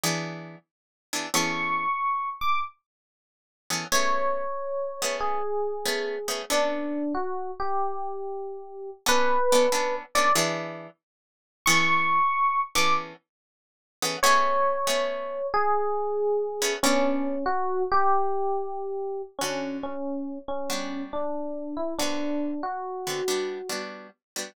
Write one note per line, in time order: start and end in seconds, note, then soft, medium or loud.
0.03 0.56 E3 loud
0.03 0.56 B3 loud
0.03 0.56 D4 medium
0.03 0.56 G#4 loud
1.13 1.27 E3 medium
1.13 1.27 B3 medium
1.13 1.27 D4 medium
1.13 1.27 G#4 medium
1.34 1.86 E3 medium
1.34 1.86 B3 loud
1.34 1.86 C#4 loud
1.34 1.86 G#4 medium
1.34 1.86 A4 loud
1.34 2.29 C#6 loud
2.41 2.59 D6 medium
3.70 3.85 E3 medium
3.70 3.85 B3 medium
3.70 3.85 C#4 medium
3.70 3.85 G#4 medium
3.70 3.85 A4 medium
3.92 4.44 A3 medium
3.92 4.44 B3 loud
3.92 4.44 C#4 medium
3.92 4.44 G#4 loud
3.92 5.16 C#5 loud
5.02 5.40 A3 medium
5.02 5.40 B3 medium
5.02 5.40 C#4 medium
5.02 5.40 G#4 medium
5.20 6.39 G#4 loud
5.85 6.16 A3 medium
5.85 6.16 B3 medium
5.85 6.16 C#4 medium
5.85 6.16 G#4 medium
6.28 6.42 A3 medium
6.28 6.42 B3 medium
6.28 6.42 C#4 medium
6.28 6.42 G#4 medium
6.50 7.02 B3 medium
6.50 7.02 C#4 medium
6.50 7.02 D4 loud
6.50 7.13 D4 loud
6.50 7.02 A4 loud
7.15 7.51 F#4 medium
7.60 8.90 G4 loud
9.06 9.37 B3 loud
9.06 9.37 C#4 loud
9.06 9.37 D4 loud
9.06 9.37 A4 loud
9.06 9.95 B4 loud
9.52 9.67 B3 loud
9.52 9.67 C#4 medium
9.52 9.67 D4 medium
9.52 9.67 A4 medium
9.72 10.03 B3 medium
9.72 10.03 C#4 medium
9.72 10.03 D4 medium
9.72 10.03 A4 medium
10.15 10.30 B3 medium
10.15 10.30 C#4 loud
10.15 10.30 D4 medium
10.15 10.30 A4 medium
10.15 10.33 D5 loud
10.35 10.88 E3 loud
10.35 10.88 B3 loud
10.35 10.88 D4 loud
10.35 10.88 G#4 loud
11.66 12.19 E3 loud
11.66 12.19 B3 loud
11.66 12.19 C#4 loud
11.66 12.19 G#4 loud
11.66 12.19 A4 loud
11.66 12.60 C#6 loud
12.75 13.13 E3 medium
12.75 13.13 B3 medium
12.75 13.13 C#4 medium
12.75 13.13 G#4 medium
12.75 13.13 A4 medium
12.75 12.93 D6 loud
14.02 14.17 E3 medium
14.02 14.17 B3 loud
14.02 14.17 C#4 medium
14.02 14.17 G#4 loud
14.02 14.17 A4 medium
14.23 14.76 A3 loud
14.23 14.76 B3 loud
14.23 14.76 C#4 loud
14.23 14.76 G#4 loud
14.23 15.47 C#5 loud
14.87 15.39 A3 medium
14.87 15.39 B3 medium
14.87 15.39 C#4 medium
14.87 15.39 G#4 medium
15.54 16.72 G#4 loud
16.62 16.76 A3 medium
16.62 16.76 B3 loud
16.62 16.76 C#4 loud
16.62 16.76 G#4 medium
16.83 17.36 B3 loud
16.83 17.44 C#4 loud
16.83 17.36 C#4 loud
16.83 17.36 D4 loud
16.83 17.36 A4 loud
17.46 17.83 F#4 loud
17.92 19.22 G4 loud
19.39 19.94 D3 medium
19.39 19.78 C#4 loud
19.39 19.94 C#4 medium
19.39 19.94 F#4 medium
19.39 19.94 A4 medium
19.83 20.38 C#4 medium
20.48 21.02 C#4 medium
20.70 21.22 G3 medium
20.70 21.22 B3 medium
20.70 21.22 D4 medium
20.70 21.22 F#4 medium
21.13 21.75 D4 medium
21.77 21.94 E4 medium
21.99 22.52 D3 medium
21.99 22.52 B3 medium
21.99 22.52 C4 medium
21.99 22.62 D4 loud
21.99 22.52 F#4 medium
22.63 23.80 F#4 medium
23.07 23.21 D3 medium
23.07 23.21 B3 medium
23.07 23.21 C4 medium
23.07 23.21 F#4 medium
23.28 23.59 G3 medium
23.28 23.59 B3 medium
23.28 23.59 D4 medium
23.28 23.59 F#4 medium
23.69 24.08 G3 medium
23.69 24.08 B3 medium
23.69 24.08 D4 medium
23.69 24.08 F#4 medium
24.36 24.50 G3 medium
24.36 24.50 B3 medium
24.36 24.50 D4 medium
24.36 24.50 F#4 medium